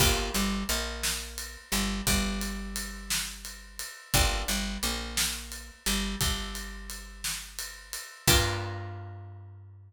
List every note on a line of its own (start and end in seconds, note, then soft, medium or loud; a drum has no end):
0.00 0.29 G1 medium
0.00 0.31 A#3 medium
0.00 0.31 D4 medium
0.00 0.31 F4 medium
0.00 0.31 G4 medium
0.00 kick loud
0.00 crash loud
0.34 0.64 G1 medium
0.34 0.64 G3 medium
0.34 ride medium
0.69 1.57 A#1 medium
0.69 1.57 A#3 medium
0.69 ride medium
1.03 snare loud
1.38 ride medium
1.72 2.01 G1 medium
1.72 2.01 G3 medium
1.72 ride medium
2.07 3.83 G1 medium
2.07 3.83 G3 medium
2.07 kick medium
2.07 ride medium
2.41 ride medium
2.76 ride medium
3.10 snare loud
3.45 ride medium
3.79 ride medium
4.14 4.43 G1 loud
4.14 4.45 A#3 medium
4.14 4.45 D4 medium
4.14 4.45 F4 medium
4.14 4.45 G4 medium
4.14 kick loud
4.14 ride medium
4.48 4.78 G1 medium
4.48 4.78 G3 medium
4.48 ride medium
4.83 5.71 A#1 medium
4.83 5.71 A#3 medium
4.83 ride medium
5.17 snare loud
5.52 ride medium
5.86 6.16 G1 medium
5.86 6.16 G3 medium
5.86 ride medium
6.21 7.97 G1 medium
6.21 7.97 G3 medium
6.21 kick medium
6.21 ride medium
6.55 ride medium
6.90 ride medium
7.24 snare medium
7.59 ride medium
7.93 ride medium
8.27 9.93 G2 loud
8.27 9.93 A#3 loud
8.27 9.93 D4 loud
8.27 9.93 F4 loud
8.27 9.93 G4 loud
8.27 kick loud
8.27 crash loud